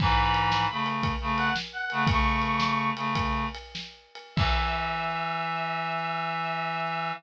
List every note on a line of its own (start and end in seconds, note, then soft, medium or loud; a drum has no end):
0.00 0.66 G#2 loud
0.00 0.66 E3 loud
0.00 0.84 B5 medium
0.00 kick loud
0.00 crash loud
0.34 ride medium
0.52 snare loud
0.71 1.13 C#3 medium
0.71 1.13 A3 medium
0.86 ride medium
1.03 kick medium
1.03 ride medium
1.21 1.50 C#3 medium
1.21 1.50 A3 loud
1.37 1.54 F#5 medium
1.37 ride medium
1.56 snare loud
1.73 2.04 F#5 medium
1.90 2.07 C#3 loud
1.90 2.07 A3 loud
1.90 ride medium
2.07 2.91 C#3 loud
2.07 2.91 A3 loud
2.07 2.89 C#6 medium
2.07 kick loud
2.07 ride loud
2.42 ride medium
2.60 snare loud
2.96 3.45 C#3 medium
2.96 3.45 A3 loud
2.96 ride medium
3.15 kick medium
3.15 ride loud
3.55 ride medium
3.75 snare loud
4.15 ride medium
4.36 7.12 E3 loud
4.36 7.11 E5 loud
4.36 kick loud
4.36 crash loud